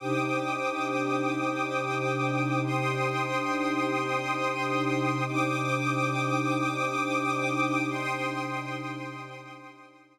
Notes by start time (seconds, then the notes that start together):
0.00 C3 D4 D#4 G4 C5 G5 D6 D#6
2.63 C5 G5 C6 D#6
5.25 C3 D4 D#4 G4 C5 G5 D6 D#6
7.89 C5 G5 C6 D#6